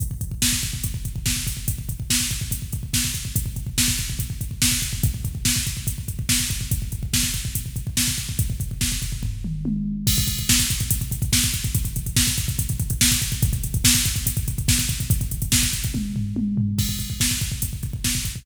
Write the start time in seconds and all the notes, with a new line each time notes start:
0.00 kick, closed hi-hat
0.11 kick
0.21 kick, closed hi-hat
0.31 kick
0.42 kick, snare
0.53 kick
0.63 kick, closed hi-hat
0.73 kick
0.84 kick, closed hi-hat
0.94 kick
1.05 kick, closed hi-hat
1.16 kick
1.26 kick, snare
1.36 kick
1.47 kick, open hi-hat
1.57 kick
1.68 kick, closed hi-hat
1.78 kick
1.89 kick, closed hi-hat
2.00 kick
2.10 kick, snare
2.20 kick
2.31 kick, closed hi-hat
2.41 kick
2.51 kick, closed hi-hat
2.62 kick
2.73 kick, closed hi-hat
2.83 kick
2.93 kick, snare
3.05 kick
3.14 kick, closed hi-hat
3.25 kick
3.36 kick, closed hi-hat
3.46 kick
3.56 kick, closed hi-hat
3.67 kick
3.78 kick, snare
3.88 kick
3.98 kick, closed hi-hat
4.10 kick
4.19 kick, closed hi-hat
4.30 kick
4.41 kick, closed hi-hat
4.51 kick
4.62 kick, snare
4.72 kick
4.82 kick, closed hi-hat
4.93 kick
5.03 kick, closed hi-hat
5.14 kick
5.25 kick, closed hi-hat
5.35 kick
5.45 kick, snare
5.56 kick
5.67 kick, closed hi-hat
5.77 kick
5.87 kick, closed hi-hat
5.98 kick
6.08 kick, closed hi-hat
6.19 kick
6.29 kick, snare
6.40 kick
6.50 kick, closed hi-hat
6.61 kick
6.71 kick, closed hi-hat
6.82 kick
6.92 kick, closed hi-hat
7.03 kick
7.13 kick, snare
7.23 kick
7.34 kick, closed hi-hat
7.45 kick
7.55 kick, closed hi-hat
7.66 kick
7.76 kick, closed hi-hat
7.87 kick
7.97 kick, snare
8.08 kick
8.18 kick, closed hi-hat
8.29 kick
8.39 kick, closed hi-hat
8.50 kick
8.60 kick, closed hi-hat
8.71 kick
8.81 kick, snare
8.92 kick
9.02 kick, closed hi-hat
9.12 kick
9.23 kick, floor tom
9.44 mid tom
9.65 high tom
10.07 kick, crash
10.17 kick, closed hi-hat
10.27 kick, closed hi-hat
10.38 kick, closed hi-hat
10.49 kick, snare
10.59 kick, closed hi-hat
10.70 kick, closed hi-hat
10.80 kick, closed hi-hat
10.91 kick, closed hi-hat
11.01 kick, closed hi-hat
11.11 kick, closed hi-hat
11.22 kick, closed hi-hat
11.33 kick, snare
11.43 kick, closed hi-hat
11.54 kick, closed hi-hat
11.64 kick, closed hi-hat
11.75 kick, closed hi-hat
11.85 kick, closed hi-hat
11.96 kick, closed hi-hat
12.06 kick, closed hi-hat
12.16 kick, snare
12.27 kick, closed hi-hat
12.38 kick, closed hi-hat
12.48 kick, closed hi-hat
12.59 kick, closed hi-hat
12.69 kick, closed hi-hat
12.80 kick, closed hi-hat
12.90 kick, closed hi-hat
13.01 kick, snare
13.11 kick, closed hi-hat
13.22 kick, closed hi-hat
13.32 kick, closed hi-hat
13.42 kick, closed hi-hat
13.53 kick, closed hi-hat
13.64 kick, closed hi-hat
13.74 kick, closed hi-hat
13.84 kick, snare
13.94 kick, closed hi-hat
14.05 kick, closed hi-hat
14.16 kick, closed hi-hat
14.26 kick, closed hi-hat
14.37 kick, closed hi-hat
14.48 kick, closed hi-hat
14.58 kick, closed hi-hat
14.68 kick, snare
14.79 kick, closed hi-hat
14.89 kick, closed hi-hat
15.00 kick, closed hi-hat
15.10 kick, closed hi-hat
15.21 kick, closed hi-hat
15.31 kick, closed hi-hat
15.42 kick, closed hi-hat
15.52 kick, snare
15.63 kick, closed hi-hat
15.73 kick, closed hi-hat
15.84 kick, closed hi-hat
15.94 kick, high tom
16.16 floor tom
16.36 high tom
16.57 floor tom
16.78 kick, crash
16.89 kick
16.99 kick, closed hi-hat
17.10 kick
17.20 kick, snare
17.31 kick
17.41 kick, closed hi-hat
17.52 kick
17.62 kick, closed hi-hat
17.73 kick
17.83 kick, closed hi-hat
17.93 kick
18.04 kick, snare
18.15 kick
18.25 kick, closed hi-hat
18.36 kick